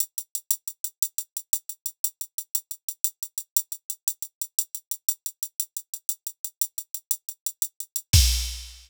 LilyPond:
\new DrumStaff \drummode { \time 6/8 \tempo 4. = 118 hh8 hh8 hh8 hh8 hh8 hh8 | hh8 hh8 hh8 hh8 hh8 hh8 | hh8 hh8 hh8 hh8 hh8 hh8 | hh8 hh8 hh8 hh8 hh8 hh8 |
hh8 hh8 hh8 hh8 hh8 hh8 | hh8 hh8 hh8 hh8 hh8 hh8 | hh8 hh8 hh8 hh8 hh8 hh8 | hh8 hh8 hh8 hh8 hh8 hh8 |
<cymc bd>4. r4. | }